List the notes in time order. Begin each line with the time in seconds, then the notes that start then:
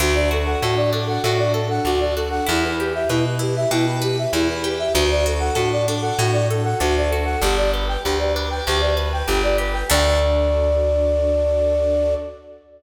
0.00 D2 D4 F#4 A4
0.15 D5
0.31 F#4 A4
0.46 F#5
0.62 A2 F#4 A4
0.76 D5
0.93 D4 A4
1.07 F#5
1.24 A2 F#4
1.38 D5
1.54 A4
1.70 F#5
1.85 D2 D4 F#4
2.00 D5
2.16 F#4 A4
2.30 F#5
2.47 E2 E4 G4 B4
2.64 B4
2.79 G4
2.95 E5
3.09 B2 E4 B4
3.26 B4
3.39 E4 G4
3.56 E5
3.71 B2 E4 G4
3.87 B4
4.02 G4 B4
4.18 E5
4.33 E2 E4
4.49 B4
4.64 G4
4.79 E5
4.94 D2 D4 F#4 A4
5.11 D5
5.26 F#4 A4
5.40 F#5
5.55 A2 F#4 A4
5.72 D5
5.88 D4 A4
6.02 F#5
6.19 A2 F#4
6.32 D5
6.49 A4
6.64 F#5
6.80 D2 D4 F#4
6.97 D5
7.10 F#4 A4
7.25 F#5
7.41 G1 D4 G4
7.57 D5
7.73 G4 B4
7.88 G5
8.04 D2 G4 B4
8.19 D5
8.35 D4 B4
8.50 G5
8.67 D2 G4
8.80 D5
8.97 B4
9.13 G5
9.28 G1 D4 G4
9.43 D5
9.58 G4 B4
9.73 G5
9.89 D2 D4 F#4 A4 D5